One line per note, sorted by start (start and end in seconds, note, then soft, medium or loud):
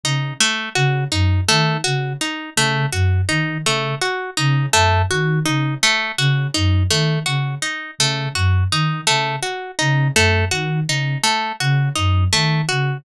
0.03 0.32 C#3 medium
0.03 0.34 D#4 medium
0.40 0.69 A3 medium
0.75 1.04 C#3 medium
0.75 1.04 F#4 medium
1.11 1.40 F#2 medium
1.11 1.41 D#4 medium
1.48 1.77 D#3 medium
1.48 1.77 A3 medium
1.84 2.14 C#3 medium
1.84 2.13 F#4 medium
2.21 2.50 D#4 medium
2.56 2.85 C#3 medium
2.56 2.86 A3 medium
2.92 3.21 F#2 medium
2.92 3.21 F#4 medium
3.29 3.58 D#3 medium
3.29 3.58 D#4 medium
3.65 3.94 C#3 medium
3.65 3.95 A3 medium
4.01 4.30 F#4 medium
4.37 4.67 C#3 medium
4.37 4.66 D#4 medium
4.73 5.02 F#2 medium
4.73 5.02 A3 medium
5.10 5.39 D#3 medium
5.10 5.39 F#4 medium
5.45 5.75 C#3 medium
5.45 5.74 D#4 medium
5.83 6.12 A3 medium
6.18 6.47 C#3 medium
6.18 6.47 F#4 medium
6.54 6.84 F#2 medium
6.54 6.83 D#4 medium
6.89 7.18 D#3 medium
6.89 7.19 A3 medium
7.26 7.55 C#3 medium
7.26 7.55 F#4 medium
7.62 7.91 D#4 medium
7.98 8.27 C#3 medium
7.98 8.29 A3 medium
8.35 8.64 F#2 medium
8.35 8.64 F#4 medium
8.71 9.00 D#3 medium
8.71 9.01 D#4 medium
9.07 9.37 C#3 medium
9.07 9.36 A3 medium
9.42 9.71 F#4 medium
9.79 10.09 C#3 medium
9.79 10.08 D#4 medium
10.15 10.44 F#2 medium
10.15 10.45 A3 medium
10.51 10.80 D#3 medium
10.51 10.80 F#4 medium
10.87 11.16 C#3 medium
10.87 11.18 D#4 medium
11.23 11.52 A3 medium
11.60 11.89 C#3 medium
11.60 11.89 F#4 medium
11.95 12.25 F#2 medium
11.95 12.24 D#4 medium
12.32 12.61 D#3 medium
12.32 12.61 A3 medium
12.69 12.98 C#3 medium
12.69 12.97 F#4 medium